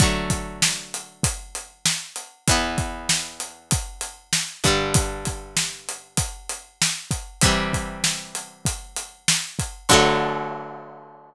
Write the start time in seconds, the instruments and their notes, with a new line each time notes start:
0.00 acoustic guitar (steel) D3 F#3 A3, kick, closed hi-hat
0.30 kick, closed hi-hat
0.62 snare
0.94 closed hi-hat
1.23 kick, closed hi-hat
1.55 closed hi-hat
1.86 snare
2.16 closed hi-hat
2.48 acoustic guitar (steel) E2 E3 B3, kick, closed hi-hat
2.78 kick, closed hi-hat
3.09 snare
3.40 closed hi-hat
3.71 kick, closed hi-hat
4.01 closed hi-hat
4.33 snare
4.64 acoustic guitar (steel) G2 D3 G3, kick, closed hi-hat
4.94 kick, closed hi-hat
5.25 kick, closed hi-hat
5.57 snare
5.89 closed hi-hat
6.17 kick, closed hi-hat
6.49 closed hi-hat
6.82 snare
7.11 kick, closed hi-hat
7.41 acoustic guitar (steel) C3 E3, kick, closed hi-hat
7.46 acoustic guitar (steel) G3
7.73 kick, closed hi-hat
8.04 snare
8.35 closed hi-hat
8.65 kick, closed hi-hat
8.96 closed hi-hat
9.28 snare
9.59 kick, closed hi-hat
9.89 acoustic guitar (steel) D3 F#3 A3, kick, crash